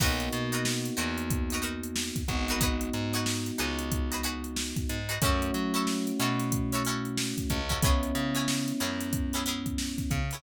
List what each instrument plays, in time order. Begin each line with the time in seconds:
0.00 electric bass (finger) B1, electric piano 1 A#3 B3 D#4 F#4, pizzicato strings D#4 F#4 A#4 B4, kick, crash
0.20 closed hi-hat
0.32 electric bass (finger) B2, closed hi-hat
0.52 pizzicato strings D#4 F#4 A#4 B4, closed hi-hat
0.65 snare
0.85 closed hi-hat
0.97 electric bass (finger) E2, pizzicato strings D#4 F#4 A#4 B4, closed hi-hat
1.18 closed hi-hat
1.30 kick, closed hi-hat
1.50 pizzicato strings D#4 F#4 A#4, closed hi-hat
1.55 pizzicato strings B4
1.62 pizzicato strings D#4 F#4 A#4 B4, closed hi-hat
1.83 closed hi-hat
1.96 snare
2.16 kick, closed hi-hat
2.28 electric bass (finger) G#1, electric piano 1 G#3 B3 D#4 F#4, kick, closed hi-hat
2.48 pizzicato strings D#4 F#4 A#4 B4, closed hi-hat
2.61 pizzicato strings D#4 F#4 G#4 B4, kick, closed hi-hat
2.81 closed hi-hat
2.93 electric bass (finger) G#2, closed hi-hat
3.13 pizzicato strings D#4 F#4 G#4 B4, closed hi-hat
3.26 snare
3.46 closed hi-hat
3.58 electric bass (finger) C#2, pizzicato strings D#4 F#4 G#4 B4, snare, closed hi-hat
3.79 closed hi-hat
3.92 kick, closed hi-hat
4.12 pizzicato strings D#4 F#4 G#4 B4, closed hi-hat
4.23 pizzicato strings D#4 F#4 G#4 B4, closed hi-hat
4.44 closed hi-hat
4.56 snare
4.76 kick, closed hi-hat
4.89 electric bass (finger) G#2, closed hi-hat
5.09 pizzicato strings D#4 F#4 G#4 B4, closed hi-hat
5.21 electric bass (finger) F#2, electric piano 1 A3 C#4 E4 F#4, pizzicato strings C#4 E4 F#4, kick, closed hi-hat
5.26 pizzicato strings A4
5.42 closed hi-hat
5.54 electric bass (finger) F#3, closed hi-hat
5.74 pizzicato strings C#4 E4 F#4 A4, closed hi-hat
5.87 snare
6.07 closed hi-hat
6.20 electric bass (finger) B2, pizzicato strings C#4 E4 F#4 A4, closed hi-hat
6.40 snare, closed hi-hat
6.52 kick, closed hi-hat
6.72 pizzicato strings C#4 E4 F#4 A4, closed hi-hat
6.85 pizzicato strings C#4 E4 F#4, closed hi-hat
6.89 pizzicato strings A4
7.05 closed hi-hat
7.18 snare
7.38 kick, closed hi-hat
7.50 electric bass (finger) C#2, kick, closed hi-hat
7.69 pizzicato strings C#4 E4 F#4 A4, kick, closed hi-hat
7.82 electric piano 1 G#3 B3 C#4 E4, pizzicato strings B3 C#4 E4 G#4, kick, closed hi-hat
8.03 closed hi-hat
8.15 electric bass (finger) C#3, closed hi-hat
8.35 pizzicato strings B3 C#4 E4 G#4, closed hi-hat
8.48 snare
8.68 snare, closed hi-hat
8.80 electric bass (finger) F#2, pizzicato strings B3 C#4 E4 G#4, closed hi-hat
9.00 snare, closed hi-hat
9.13 kick, closed hi-hat
9.33 pizzicato strings B3 C#4 E4 G#4, closed hi-hat
9.46 pizzicato strings B3 C#4 E4 G#4, closed hi-hat
9.66 kick, closed hi-hat
9.78 snare
9.98 kick, snare, closed hi-hat
10.11 electric bass (finger) C#3, kick, closed hi-hat
10.31 pizzicato strings B3 C#4 E4, closed hi-hat
10.35 pizzicato strings G#4